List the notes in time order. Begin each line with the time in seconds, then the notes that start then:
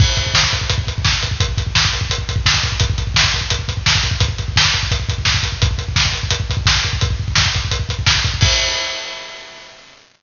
0.00 kick, crash
0.17 kick, closed hi-hat
0.26 kick
0.34 kick, snare
0.43 kick
0.53 kick, closed hi-hat
0.61 kick
0.70 kick, closed hi-hat
0.78 kick
0.87 kick, closed hi-hat
0.98 kick
1.05 kick, snare
1.13 kick
1.23 kick, closed hi-hat
1.31 kick
1.40 kick, closed hi-hat
1.49 kick
1.57 kick, closed hi-hat
1.67 kick
1.75 kick, snare
1.85 kick
1.93 kick, closed hi-hat
2.01 kick
2.10 kick, closed hi-hat
2.18 kick
2.29 kick, closed hi-hat
2.36 kick
2.46 kick, snare
2.54 kick
2.63 kick, closed hi-hat
2.72 kick
2.80 kick, closed hi-hat
2.90 kick
2.98 kick, closed hi-hat
3.07 kick
3.14 kick, snare
3.24 kick
3.34 kick, closed hi-hat
3.41 kick
3.50 kick, closed hi-hat
3.59 kick
3.68 kick, closed hi-hat
3.77 kick
3.86 kick, snare
3.95 kick
4.03 kick, closed hi-hat
4.11 kick
4.20 kick, closed hi-hat
4.28 kick
4.38 kick, closed hi-hat
4.48 kick
4.56 kick, snare
4.65 kick
4.73 kick, closed hi-hat
4.83 kick
4.91 kick, closed hi-hat
5.00 kick
5.09 kick, closed hi-hat
5.18 kick
5.25 kick, snare
5.34 kick
5.43 kick, closed hi-hat
5.52 kick
5.62 kick, closed hi-hat
5.71 kick
5.78 kick, closed hi-hat
5.88 kick
5.96 kick, snare
6.05 kick
6.13 kick, closed hi-hat
6.23 kick
6.30 kick, closed hi-hat
6.40 kick
6.50 kick, closed hi-hat
6.57 kick
6.66 kick, snare
6.76 kick
6.84 kick, closed hi-hat
6.93 kick
7.01 kick, closed hi-hat
7.11 kick
7.20 kick
7.28 kick
7.35 kick, snare
7.46 kick
7.54 kick, closed hi-hat
7.65 kick
7.71 kick, closed hi-hat
7.79 kick
7.89 kick, closed hi-hat
7.99 kick
8.06 kick, snare
8.15 kick
8.24 kick, closed hi-hat
8.34 kick
8.41 kick, crash